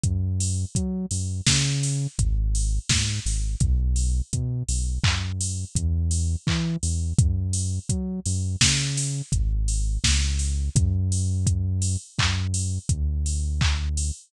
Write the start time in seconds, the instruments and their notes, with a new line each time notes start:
0.03 synth bass 1 F#2, kick, closed hi-hat
0.40 open hi-hat
0.75 synth bass 1 F#3, kick, closed hi-hat
1.11 synth bass 1 F#2, open hi-hat
1.46 synth bass 1 C#3, kick, snare
1.83 open hi-hat
2.18 synth bass 1 G#1, kick, closed hi-hat
2.55 open hi-hat
2.89 synth bass 1 G#2, kick, snare
3.25 synth bass 1 G#1, open hi-hat
3.60 synth bass 1 B1, kick, closed hi-hat
3.96 open hi-hat
4.33 synth bass 1 B2, kick, closed hi-hat
4.68 synth bass 1 B1, open hi-hat
5.04 synth bass 1 F#2, kick, clap
5.40 open hi-hat
5.75 synth bass 1 E2, kick, closed hi-hat
6.11 open hi-hat
6.47 synth bass 1 E3, kick, clap
6.83 synth bass 1 E2, open hi-hat
7.18 synth bass 1 F#2, kick, closed hi-hat
7.53 open hi-hat
7.89 synth bass 1 F#3, kick, closed hi-hat
8.25 synth bass 1 F#2, open hi-hat
8.61 synth bass 1 C#3, kick, snare
8.97 open hi-hat
9.32 synth bass 1 G#1, kick, closed hi-hat
9.68 open hi-hat
10.04 synth bass 1 C#2, kick, snare
10.39 open hi-hat
10.75 synth bass 1 F#2, kick, closed hi-hat
11.12 open hi-hat
11.47 kick, closed hi-hat
11.82 open hi-hat
12.18 synth bass 1 F#2, kick, clap
12.54 open hi-hat
12.89 synth bass 1 D2, kick, closed hi-hat
13.26 open hi-hat
13.61 kick, clap
13.97 open hi-hat